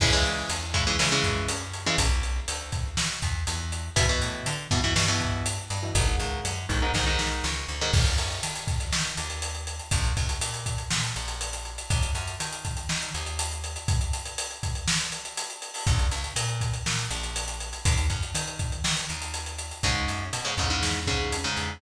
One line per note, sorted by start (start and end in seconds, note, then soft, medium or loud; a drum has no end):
0.00 0.42 C#2 medium
0.00 0.11 C#3 loud
0.00 0.11 E3 loud
0.00 0.11 G#3 loud
0.00 kick loud
0.00 crash loud
0.13 0.52 C#3 medium
0.13 0.52 E3 medium
0.13 0.52 G#3 loud
0.25 closed hi-hat medium
0.49 0.92 E2 medium
0.49 closed hi-hat loud
0.74 0.84 C#3 medium
0.74 0.84 E3 medium
0.74 0.84 G#3 medium
0.74 kick medium
0.74 closed hi-hat medium
0.87 0.97 C#3 medium
0.87 0.97 E3 loud
0.87 0.97 G#3 medium
0.99 1.20 C#3 medium
0.99 1.10 C#3 medium
0.99 1.10 E3 medium
0.99 1.10 G#3 medium
0.99 snare loud
1.12 1.52 C#3 loud
1.12 1.52 E3 loud
1.12 1.52 G#3 loud
1.24 1.45 F#2 medium
1.24 kick medium
1.24 closed hi-hat medium
1.48 1.90 F#2 medium
1.48 closed hi-hat loud
1.73 closed hi-hat medium
1.86 1.96 C#3 medium
1.86 1.96 E3 loud
1.86 1.96 G#3 loud
1.98 2.40 B1 medium
1.98 kick medium
1.98 closed hi-hat loud
2.23 closed hi-hat medium
2.48 2.91 D2 medium
2.48 closed hi-hat loud
2.72 kick loud
2.72 closed hi-hat medium
2.97 3.19 B2 medium
2.97 snare loud
3.22 3.44 E2 medium
3.22 kick medium
3.22 closed hi-hat medium
3.47 3.90 E2 medium
3.47 closed hi-hat loud
3.72 closed hi-hat medium
3.96 4.18 E2 medium
3.96 4.06 B2 loud
3.96 4.06 E3 loud
3.96 kick loud
3.96 closed hi-hat loud
4.09 4.49 B2 medium
4.09 4.49 E3 medium
4.21 4.42 A2 medium
4.21 closed hi-hat medium
4.46 4.67 D3 medium
4.46 closed hi-hat loud
4.71 4.93 G2 medium
4.71 4.81 B2 loud
4.71 4.81 E3 medium
4.71 kick loud
4.71 closed hi-hat medium
4.84 4.94 B2 medium
4.84 4.94 E3 medium
4.96 5.59 G2 medium
4.96 5.06 B2 medium
4.96 5.06 E3 medium
4.96 snare loud
5.08 5.48 B2 medium
5.08 5.48 E3 medium
5.20 kick medium
5.20 closed hi-hat medium
5.46 closed hi-hat loud
5.70 5.91 G2 medium
5.70 closed hi-hat medium
5.83 5.93 B2 medium
5.83 5.93 E3 loud
5.95 6.16 G#1 loud
5.95 6.05 G#2 loud
5.95 6.05 D#3 loud
5.95 kick loud
5.95 closed hi-hat loud
6.07 6.47 G#2 loud
6.07 6.47 D#3 medium
6.20 6.41 C#2 medium
6.20 closed hi-hat medium
6.45 6.66 F#2 medium
6.45 closed hi-hat loud
6.69 6.91 B1 medium
6.69 6.79 G#2 medium
6.69 6.79 D#3 medium
6.69 kick medium
6.69 closed hi-hat medium
6.82 6.92 G#2 medium
6.82 6.92 D#3 loud
6.94 7.41 B1 medium
6.94 7.05 G#2 medium
6.94 7.05 D#3 loud
6.94 kick medium
6.94 snare loud
7.07 7.46 G#2 medium
7.07 7.46 D#3 loud
7.19 snare loud
7.44 7.66 C#2 medium
7.44 snare medium
7.68 7.91 D2 medium
7.81 7.91 G#2 medium
7.81 7.91 D#3 loud
7.93 8.15 D#2 medium
7.93 kick loud
7.93 crash loud
8.06 closed hi-hat medium
8.18 8.40 F#2 medium
8.18 closed hi-hat medium
8.30 closed hi-hat medium
8.43 8.85 D#3 medium
8.43 closed hi-hat loud
8.55 closed hi-hat medium
8.67 kick loud
8.67 closed hi-hat medium
8.80 closed hi-hat medium
8.92 9.14 D#3 medium
8.92 snare loud
9.05 closed hi-hat medium
9.17 9.81 D#2 medium
9.17 closed hi-hat medium
9.30 closed hi-hat medium
9.42 closed hi-hat loud
9.55 closed hi-hat medium
9.67 closed hi-hat medium
9.79 closed hi-hat medium
9.91 10.13 A#1 medium
9.91 kick loud
9.91 closed hi-hat loud
10.04 closed hi-hat medium
10.17 10.38 C#2 medium
10.17 kick medium
10.17 closed hi-hat medium
10.29 closed hi-hat medium
10.41 10.83 A#2 medium
10.41 closed hi-hat loud
10.54 closed hi-hat medium
10.66 kick medium
10.66 closed hi-hat medium
10.78 closed hi-hat medium
10.90 11.12 A#2 medium
10.90 snare loud
11.03 closed hi-hat medium
11.16 11.79 A#1 medium
11.16 closed hi-hat medium
11.28 closed hi-hat medium
11.41 closed hi-hat loud
11.53 closed hi-hat medium
11.65 closed hi-hat medium
11.78 closed hi-hat medium
11.90 12.11 D#2 medium
11.90 kick loud
11.90 closed hi-hat loud
12.02 closed hi-hat medium
12.15 12.36 F#2 medium
12.15 closed hi-hat medium
12.27 closed hi-hat medium
12.40 12.82 D#3 medium
12.40 closed hi-hat loud
12.52 closed hi-hat medium
12.65 kick medium
12.65 closed hi-hat medium
12.77 closed hi-hat medium
12.89 13.11 D#3 medium
12.89 snare loud
13.02 closed hi-hat medium
13.14 13.77 D#2 medium
13.14 closed hi-hat medium
13.26 closed hi-hat medium
13.39 closed hi-hat loud
13.51 closed hi-hat medium
13.64 closed hi-hat medium
13.76 closed hi-hat medium
13.88 kick loud
13.88 closed hi-hat loud
14.01 closed hi-hat medium
14.13 closed hi-hat loud
14.26 closed hi-hat medium
14.38 closed hi-hat loud
14.51 closed hi-hat medium
14.63 kick medium
14.63 closed hi-hat medium
14.75 closed hi-hat medium
14.88 snare loud
15.01 closed hi-hat medium
15.12 closed hi-hat medium
15.25 closed hi-hat medium
15.37 closed hi-hat loud
15.50 closed hi-hat medium
15.62 closed hi-hat medium
15.74 open hi-hat medium
15.87 16.08 A#1 medium
15.87 kick loud
15.87 closed hi-hat medium
15.99 closed hi-hat medium
16.11 16.33 C#2 medium
16.11 closed hi-hat medium
16.24 closed hi-hat medium
16.36 16.78 A#2 medium
16.36 closed hi-hat loud
16.49 closed hi-hat medium
16.61 kick medium
16.61 closed hi-hat medium
16.74 closed hi-hat medium
16.86 17.07 A#2 medium
16.86 snare loud
16.99 closed hi-hat medium
17.10 17.74 A#1 medium
17.10 closed hi-hat medium
17.23 closed hi-hat medium
17.36 closed hi-hat loud
17.48 closed hi-hat medium
17.60 closed hi-hat medium
17.73 closed hi-hat medium
17.85 18.07 D#2 medium
17.85 kick loud
17.85 closed hi-hat loud
17.98 closed hi-hat medium
18.10 18.31 F#2 medium
18.10 kick medium
18.10 closed hi-hat medium
18.23 closed hi-hat medium
18.34 18.77 D#3 medium
18.34 closed hi-hat loud
18.47 closed hi-hat medium
18.59 kick medium
18.59 closed hi-hat medium
18.72 closed hi-hat medium
18.84 19.05 D#3 medium
18.84 snare loud
18.97 closed hi-hat medium
19.09 19.73 D#2 medium
19.09 closed hi-hat medium
19.22 closed hi-hat medium
19.34 closed hi-hat loud
19.46 closed hi-hat medium
19.58 closed hi-hat medium
19.71 closed hi-hat medium
19.83 20.05 C#2 medium
19.83 20.24 G#2 medium
19.83 20.24 C#3 medium
19.83 kick medium
19.83 closed hi-hat loud
20.08 20.30 F#2 medium
20.08 closed hi-hat medium
20.33 20.54 B2 medium
20.33 closed hi-hat loud
20.45 20.55 G#2 medium
20.45 20.55 C#3 medium
20.57 20.78 E2 medium
20.57 20.69 G#2 medium
20.57 20.69 C#3 medium
20.57 kick medium
20.57 closed hi-hat medium
20.70 21.00 G#2 medium
20.70 21.00 C#3 medium
20.82 21.46 E2 medium
20.82 snare loud
21.07 21.37 G#2 medium
21.07 21.37 C#3 medium
21.07 kick medium
21.07 closed hi-hat medium
21.32 closed hi-hat loud
21.44 21.74 G#2 medium
21.44 21.74 C#3 medium
21.57 21.78 E2 medium
21.57 closed hi-hat medium